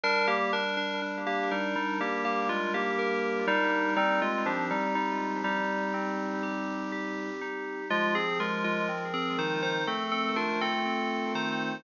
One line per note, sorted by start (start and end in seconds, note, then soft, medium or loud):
0.03 2.00 G3 medium
0.03 0.27 D4 loud
0.03 0.27 A#4 loud
0.27 0.51 A#3 medium
0.27 0.51 G4 loud
0.53 0.76 D4 medium
0.53 0.76 A#4 loud
0.77 1.00 D4 medium
0.77 1.00 A#4 medium
1.02 3.47 D4 medium
1.26 1.50 A#3 medium
1.26 1.50 G4 medium
1.51 1.75 G3 medium
1.51 1.75 D#4 medium
1.51 2.49 A#4 medium
1.76 1.99 G3 medium
1.76 1.99 D#4 medium
2.00 3.87 G3 medium
2.00 2.24 A#3 medium
2.00 2.24 G4 medium
2.25 2.48 A#3 medium
2.25 2.48 G4 medium
2.49 2.72 G#3 medium
2.49 2.72 F4 medium
2.49 2.98 A#4 medium
2.74 3.44 A#3 medium
2.74 3.44 G4 medium
2.99 3.92 A#4 medium
3.47 3.94 G3 loud
3.47 3.94 D4 medium
3.47 3.94 D#4 loud
3.97 4.20 G3 loud
3.97 5.93 C4 medium
3.97 4.20 D#4 loud
4.22 4.45 G#3 medium
4.22 4.45 F4 medium
4.46 4.69 F3 medium
4.46 4.69 D4 medium
4.46 5.44 G4 medium
4.70 4.94 G3 medium
4.70 4.94 D#4 medium
4.95 5.41 G3 medium
4.95 5.41 D#4 medium
5.44 7.30 G3 medium
5.44 7.30 D#4 loud
5.44 6.42 G4 medium
5.94 7.81 C4 medium
6.43 6.92 G4 medium
6.92 7.85 G4 medium
7.41 7.88 D#4 medium
7.90 9.77 F3 medium
7.90 8.14 G#3 loud
7.90 8.14 F4 loud
8.15 8.38 C4 medium
8.15 8.38 G#4 loud
8.40 8.63 G#3 medium
8.40 8.63 F4 medium
8.40 9.80 A#4 medium
8.64 8.88 G#3 medium
8.64 8.88 F4 loud
8.89 9.82 C4 medium
9.14 9.37 C4 medium
9.14 9.37 G#4 loud
9.38 9.85 D#3 medium
9.38 9.62 D#4 medium
9.38 9.62 C5 medium
9.63 9.86 D#4 medium
9.63 9.86 C5 loud
9.87 11.74 A3 medium
9.87 10.11 C4 medium
9.87 10.11 A4 medium
10.11 10.35 C4 medium
10.11 10.35 A4 loud
10.36 10.59 D4 medium
10.36 11.76 F4 medium
10.36 10.59 A#4 medium
10.61 11.32 C4 loud
10.61 11.32 A4 loud
10.85 11.79 C4 medium
11.35 11.81 D#3 medium
11.35 11.83 D#4 medium
11.35 11.83 C5 medium